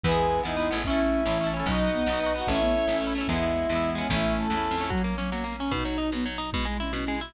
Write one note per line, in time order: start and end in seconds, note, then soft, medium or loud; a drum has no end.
0.03 0.41 E2 loud
0.03 0.85 G#3 medium
0.03 0.85 B3 medium
0.03 0.43 B3 medium
0.03 0.85 E4 medium
0.03 0.38 G#4 medium
0.03 0.41 B4 medium
0.03 kick loud
0.03 snare medium
0.09 0.43 E4 medium
0.09 0.43 G#4 medium
0.09 snare medium
0.18 snare medium
0.23 snare medium
0.31 snare medium
0.39 snare medium
0.43 0.71 E2 medium
0.43 0.56 B3 medium
0.43 0.69 D#4 medium
0.43 0.78 E4 medium
0.43 0.56 E4 medium
0.43 snare loud
0.49 0.56 G#4 medium
0.49 snare medium
0.57 0.69 B3 medium
0.57 0.69 E4 medium
0.57 snare medium
0.63 0.69 G#4 medium
0.63 snare medium
0.71 1.22 A1 medium
0.71 0.83 B3 medium
0.71 0.83 E4 medium
0.71 snare medium
0.77 0.83 G#4 medium
0.77 snare medium
0.84 1.66 A3 medium
0.84 1.21 C#4 medium
0.84 1.66 C#4 medium
0.84 1.24 C#4 medium
0.84 1.48 E4 medium
0.84 1.66 E4 medium
0.84 kick loud
0.84 snare medium
0.90 1.24 E4 medium
0.90 1.24 A4 medium
0.90 snare medium
1.00 snare loud
1.06 snare medium
1.12 snare medium
1.18 snare medium
1.25 1.62 A1 medium
1.25 1.63 E3 medium
1.25 1.38 C#4 medium
1.25 1.38 E4 medium
1.25 snare loud
1.31 1.38 A4 medium
1.31 snare medium
1.40 1.53 C#4 medium
1.40 1.53 E4 medium
1.40 snare medium
1.46 1.53 A4 medium
1.46 snare medium
1.52 1.65 C#4 medium
1.52 1.66 C#4 medium
1.52 snare medium
1.57 1.66 E4 medium
1.57 1.66 A4 medium
1.57 snare medium
1.66 2.03 B1 medium
1.66 1.89 F#3 medium
1.66 2.03 B3 medium
1.66 2.33 D#4 medium
1.66 2.03 D#4 medium
1.66 2.47 B4 medium
1.66 2.47 D#5 medium
1.66 2.47 F#5 medium
1.66 kick loud
1.66 snare medium
1.72 2.03 F#4 medium
1.72 snare medium
1.79 snare medium
1.87 snare medium
1.94 2.06 B3 medium
1.94 snare medium
2.01 snare medium
2.06 2.43 B1 medium
2.06 2.19 B3 medium
2.06 2.19 D#4 medium
2.06 snare loud
2.13 2.19 F#4 medium
2.13 snare medium
2.20 2.33 B3 medium
2.20 2.33 D#4 medium
2.20 snare medium
2.26 2.33 F#4 medium
2.26 snare medium
2.34 2.48 B3 medium
2.34 2.47 F#4 medium
2.34 snare medium
2.38 2.48 D#4 medium
2.38 2.48 F#4 medium
2.38 snare medium
2.47 2.85 A1 medium
2.47 2.86 A3 medium
2.47 2.60 C#4 medium
2.47 2.86 C#4 medium
2.47 2.96 E4 medium
2.47 3.28 A4 medium
2.47 3.28 C#5 medium
2.47 3.28 E5 medium
2.47 kick loud
2.47 snare medium
2.53 2.86 E4 medium
2.53 snare medium
2.61 2.74 B3 medium
2.61 snare medium
2.68 snare medium
2.74 2.87 C#4 medium
2.74 snare medium
2.82 snare medium
2.88 3.24 A1 medium
2.88 3.01 A3 medium
2.88 3.27 C#4 medium
2.88 snare loud
2.93 3.02 C#4 medium
2.93 3.02 E4 medium
2.93 snare medium
3.01 3.14 A3 medium
3.01 3.14 C#4 medium
3.01 snare medium
3.07 3.14 E4 medium
3.07 snare medium
3.15 3.27 A3 medium
3.15 3.27 C#4 medium
3.15 snare medium
3.21 3.27 E4 medium
3.21 snare medium
3.28 3.65 E2 medium
3.28 4.09 G#3 medium
3.28 3.67 G#3 medium
3.28 3.68 B3 medium
3.28 4.09 B3 medium
3.28 3.89 E4 medium
3.28 4.09 E4 medium
3.28 kick loud
3.28 snare medium
3.33 3.67 B3 medium
3.33 3.67 E4 medium
3.33 snare medium
3.42 snare medium
3.48 snare medium
3.56 snare medium
3.63 snare medium
3.69 4.06 E2 medium
3.69 4.02 E3 medium
3.69 3.94 G#3 medium
3.69 3.94 B3 medium
3.69 snare loud
3.76 3.94 E4 medium
3.76 snare medium
3.83 snare medium
3.89 snare medium
3.95 4.08 G#3 medium
3.95 4.08 B3 medium
3.95 4.07 C#4 medium
3.95 snare medium
4.01 4.08 E4 medium
4.01 snare medium
4.09 4.47 A1 medium
4.09 4.90 A3 medium
4.09 4.47 A3 medium
4.09 4.54 A3 medium
4.09 4.90 C#4 medium
4.09 4.90 E4 medium
4.09 4.33 E4 medium
4.09 kick loud
4.09 snare medium
4.13 4.47 C#4 medium
4.13 4.47 E4 medium
4.13 snare medium
4.23 snare medium
4.30 snare medium
4.36 4.84 A4 medium
4.36 snare medium
4.44 snare medium
4.50 4.69 E2 medium
4.50 4.76 A3 medium
4.50 snare loud
4.54 4.76 C#4 medium
4.54 4.76 E4 medium
4.54 snare medium
4.64 snare medium
4.70 4.89 F2 medium
4.70 snare medium
4.78 4.90 A3 medium
4.78 4.90 C#4 medium
4.78 snare medium
4.83 4.90 E4 medium
4.83 snare medium
4.90 5.02 F#3 loud
4.90 5.71 F#3 medium
4.90 5.14 F#3 medium
4.90 5.71 A#3 medium
4.90 5.71 C#4 medium
4.90 kick loud
4.90 snare medium
4.98 snare medium
5.04 5.16 A#3 medium
5.04 snare loud
5.12 snare medium
5.18 5.31 F#3 medium
5.18 5.30 C#4 medium
5.18 snare loud
5.26 snare medium
5.32 5.44 F#3 medium
5.32 5.54 A#3 medium
5.32 snare loud
5.38 snare medium
5.44 5.56 A#3 medium
5.44 snare medium
5.52 snare medium
5.59 5.71 C#4 medium
5.59 5.72 C#4 medium
5.59 snare medium
5.65 snare medium
5.71 5.84 B2 loud
5.71 6.52 B2 medium
5.71 6.52 F#3 medium
5.71 6.11 D#4 medium
5.71 6.52 D#4 medium
5.71 kick loud
5.71 snare medium
5.79 snare medium
5.85 5.97 F#3 medium
5.85 snare loud
5.92 snare medium
5.98 6.10 D#4 medium
5.98 snare medium
6.05 snare medium
6.12 6.25 B2 medium
6.12 6.25 B3 medium
6.12 snare loud
6.20 snare medium
6.26 6.38 F#3 medium
6.26 snare medium
6.33 snare medium
6.38 6.50 D#4 medium
6.38 snare medium
6.45 snare medium
6.53 7.33 B2 medium
6.53 6.66 B2 loud
6.53 7.33 G#3 medium
6.53 6.66 G#3 medium
6.53 7.33 E4 medium
6.53 kick loud
6.53 snare medium
6.60 snare medium
6.65 6.77 G#3 medium
6.65 6.80 G#3 medium
6.65 snare medium
6.72 snare medium
6.80 6.92 C#4 medium
6.80 6.92 E4 medium
6.80 snare medium
6.87 snare medium
6.93 7.05 B2 medium
6.93 7.15 C#4 medium
6.93 snare loud
7.00 snare medium
7.07 7.20 G#3 medium
7.07 snare medium
7.14 snare medium
7.20 7.33 E4 medium
7.20 snare medium
7.28 snare medium